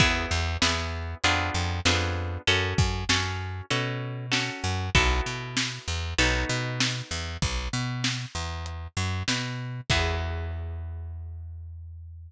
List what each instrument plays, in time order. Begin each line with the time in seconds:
0.00 electric bass (finger) E2, orchestral harp B3 E4 G#4, kick, crash
0.31 electric bass (finger) E2
0.62 electric bass (finger) E2, orchestral harp B3 E4 G#4, snare
1.24 electric bass (finger) F2, orchestral harp B3 D4 F4 G#4, closed hi-hat
1.54 electric bass (finger) F2
1.85 electric bass (finger) F2, orchestral harp B3 D4 F4 G#4, snare
2.47 electric bass (finger) F#2, orchestral harp C#4 F#4 A4, closed hi-hat
2.78 electric bass (finger) F#2, kick
3.09 electric bass (finger) F#2, orchestral harp C#4 F#4 A4, snare
3.70 electric bass (finger) B2, orchestral harp C#4 F#4 A4, closed hi-hat
4.32 orchestral harp C#4 F#4 A4, snare
4.64 electric bass (finger) F#2
4.95 electric bass (finger) B1, orchestral harp B3 E4 F#4 A4, kick, closed hi-hat
5.26 electric bass (finger) B2
5.57 snare
5.88 electric bass (finger) E2
6.18 electric bass (finger) B1, orchestral harp B3 D#4 F#4 A4, closed hi-hat
6.49 electric bass (finger) B2
6.80 snare
7.11 electric bass (finger) E2
7.42 electric bass (finger) B1, kick, closed hi-hat
7.73 electric bass (finger) B2
8.04 snare
8.35 electric bass (finger) E2
8.66 closed hi-hat
8.97 electric bass (finger) F#2
9.28 electric bass (finger) B2, snare
9.90 electric bass (finger) E2, orchestral harp B3 E4 G#4, kick, crash